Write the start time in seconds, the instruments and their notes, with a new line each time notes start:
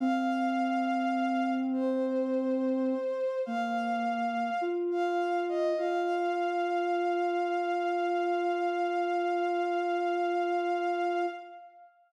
0.00 ocarina C4, violin F5
1.73 violin C5
3.46 ocarina A#3, violin F5
4.61 ocarina F4
4.91 violin F5
5.49 violin D#5
5.77 ocarina F4, violin F5